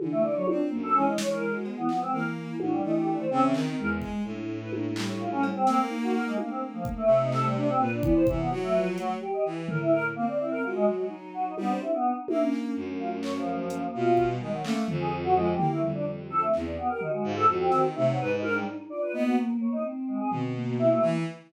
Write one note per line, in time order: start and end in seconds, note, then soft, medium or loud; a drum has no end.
0.00 0.42 D3 medium
0.00 0.32 E3 medium
0.00 high tom loud
0.12 0.22 A3 loud
0.23 0.34 D5 loud
0.35 0.47 F#3 medium
0.35 0.46 C#5 loud
0.46 0.70 C4 medium
0.46 0.58 D4 medium
0.46 0.67 F4 medium
0.46 high tom loud
0.70 0.94 F#2 medium
0.70 0.92 A#3 loud
0.83 0.94 A4 loud
0.94 1.48 E3 medium
0.94 1.79 G#3 medium
0.94 1.05 C#4 loud
1.06 1.17 D#5 medium
1.18 1.29 C#5 loud
1.18 snare loud
1.30 1.51 A#4 medium
1.53 1.63 F#4 medium
1.65 1.76 B3 medium
1.65 cowbell medium
1.77 1.88 E3 medium
1.77 1.88 B3 medium
1.88 1.99 F3 medium
1.88 2.00 B3 medium
1.88 clap medium
2.01 2.12 G#3 medium
2.01 2.11 C4 medium
2.13 2.77 E3 medium
2.13 2.56 A#3 medium
2.13 2.23 A#4 medium
2.59 2.81 A2 medium
2.59 2.71 F#4 medium
2.59 high tom loud
2.72 2.82 G3 medium
2.83 3.26 E3 medium
2.83 3.25 A3 medium
2.83 2.94 D#4 medium
2.95 3.06 G4 medium
3.07 3.18 D4 medium
3.19 3.30 C5 medium
3.30 3.52 C#3 loud
3.30 3.72 C4 loud
3.30 3.41 C4 loud
3.42 3.53 E3 soft
3.54 3.75 D#3 loud
3.54 clap medium
3.78 4.01 E2 medium
3.78 4.21 G#3 medium
3.78 3.89 A#4 medium
4.01 4.22 G#3 medium
4.01 kick medium
4.24 5.51 A2 medium
4.24 4.68 D4 medium
4.61 4.71 B4 medium
4.72 4.93 A#3 medium
4.72 high tom medium
4.96 5.60 G3 medium
4.96 clap loud
5.08 5.19 C#5 medium
5.19 5.30 F4 medium
5.31 5.42 C#4 loud
5.43 cowbell loud
5.55 5.66 C4 loud
5.67 5.88 A3 medium
5.67 6.32 A#3 loud
5.67 5.78 C4 loud
5.67 snare medium
5.89 6.32 D#4 loud
6.02 6.13 F#4 medium
6.14 6.25 A#4 medium
6.26 6.37 G#3 medium
6.38 7.66 A3 medium
6.38 6.48 A#3 medium
6.38 7.04 A#3 medium
6.38 high tom medium
6.50 6.60 C4 medium
6.73 6.84 F3 medium
6.85 kick medium
6.97 7.18 A3 loud
7.07 7.71 C3 loud
7.21 7.31 D#4 loud
7.32 7.43 A4 medium
7.32 clap medium
7.44 7.55 G3 medium
7.56 7.67 D4 loud
7.68 7.78 C4 loud
7.78 8.00 A#2 medium
7.78 8.01 A#3 medium
7.78 7.90 B4 medium
7.91 8.02 D4 medium
8.01 8.24 E3 loud
8.01 8.23 B3 medium
8.01 8.14 D5 medium
8.01 kick loud
8.15 8.26 C5 loud
8.26 8.49 C3 medium
8.26 8.47 E3 loud
8.26 8.38 E3 medium
8.26 kick loud
8.38 8.49 B3 medium
8.50 9.15 F#3 loud
8.50 8.72 F#4 medium
8.50 cowbell medium
8.62 8.73 A3 loud
8.74 8.96 F3 medium
8.74 8.85 B4 medium
8.98 9.08 F#3 medium
8.98 9.20 A3 medium
8.98 closed hi-hat medium
9.21 9.42 G4 loud
9.33 9.44 D#5 medium
9.45 9.67 E3 medium
9.68 10.11 A2 medium
9.68 9.91 E3 medium
9.68 9.79 A#4 medium
9.68 floor tom loud
9.80 9.91 E4 medium
9.92 10.03 A#4 loud
10.16 10.26 A#3 loud
10.16 10.59 C4 medium
10.28 10.38 D5 medium
10.39 10.50 E4 medium
10.51 10.62 A#4 medium
10.63 10.86 G#3 medium
10.63 10.74 F4 medium
10.63 11.06 F#4 medium
10.75 10.86 G#3 loud
10.86 11.49 F#3 soft
10.99 11.09 G#3 soft
11.09 11.52 D#4 loud
11.34 11.45 F#4 medium
11.46 11.56 D#4 medium
11.57 11.79 G3 loud
11.57 11.68 B3 medium
11.57 12.01 C4 medium
11.57 high tom medium
11.69 11.80 C5 medium
11.81 11.92 E4 medium
11.81 high tom medium
11.93 12.14 B3 medium
12.03 12.35 D#4 medium
12.28 12.39 A3 medium
12.28 12.72 A#3 medium
12.28 high tom loud
12.41 12.52 C#4 loud
12.52 12.74 C#4 medium
12.52 clap medium
12.76 13.82 F#2 medium
12.76 13.61 A3 medium
12.99 13.10 F4 medium
13.23 13.33 C#5 loud
13.23 clap medium
13.35 13.88 F3 medium
13.69 14.12 A#3 medium
13.69 closed hi-hat medium
13.94 14.37 B2 loud
13.94 14.26 F4 loud
14.17 14.49 G3 medium
14.17 kick medium
14.40 14.62 D#3 medium
14.40 14.51 G#3 medium
14.53 14.63 F#3 medium
14.63 14.85 A3 loud
14.63 14.75 A#3 loud
14.63 14.86 C#4 medium
14.63 clap loud
14.88 15.53 F2 loud
14.88 15.31 F3 medium
14.88 floor tom loud
15.00 15.11 G#4 medium
15.24 15.34 F#4 loud
15.35 15.58 F3 loud
15.35 15.46 G#3 loud
15.47 15.68 G4 soft
15.57 15.80 A#3 medium
15.57 15.79 E4 medium
15.57 floor tom loud
15.71 15.81 A3 medium
15.82 16.47 F2 medium
15.82 16.25 G3 medium
15.82 floor tom medium
15.94 16.05 D4 medium
16.30 16.63 C4 medium
16.30 16.40 A4 loud
16.30 high tom medium
16.42 16.52 A3 medium
16.54 16.75 E2 medium
16.54 clap medium
16.65 16.76 D5 medium
16.77 16.88 B3 medium
16.77 16.98 G4 medium
16.89 17.00 A#4 medium
17.01 17.12 D#4 medium
17.01 17.87 F#4 medium
17.01 floor tom medium
17.13 17.23 G#3 medium
17.24 17.45 G#2 loud
17.24 17.35 F4 medium
17.36 17.47 A4 loud
17.48 17.69 F2 loud
17.60 17.81 C4 medium
17.72 17.93 D#3 medium
17.72 snare medium
17.95 18.18 C3 loud
17.95 18.06 A3 medium
17.95 18.80 D#4 loud
18.07 18.18 F#3 medium
18.19 18.64 G#2 loud
18.19 18.30 B4 loud
18.31 18.41 D#4 medium
18.43 18.53 A#4 loud
18.43 high tom medium
18.54 18.65 G3 medium
18.90 19.12 F4 medium
18.90 19.00 D5 loud
19.02 19.12 B4 medium
19.13 19.76 A#3 loud
19.13 19.35 B3 loud
19.13 19.24 D#4 loud
19.25 19.36 F#4 medium
19.61 19.71 C#5 soft
19.72 19.83 D#4 loud
19.84 20.48 C4 loud
20.08 20.19 G#3 medium
20.20 20.30 G#4 medium
20.31 20.95 B2 medium
20.31 floor tom medium
20.54 21.18 A#3 medium
20.79 20.89 E4 loud
20.91 21.01 A3 loud
21.02 21.23 E3 loud